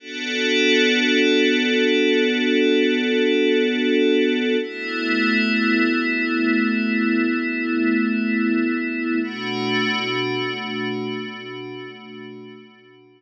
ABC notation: X:1
M:4/4
L:1/8
Q:1/4=52
K:Bm
V:1 name="Pad 5 (bowed)"
[B,DFA]8 | [A,B,E]8 | [B,,A,DF]8 |]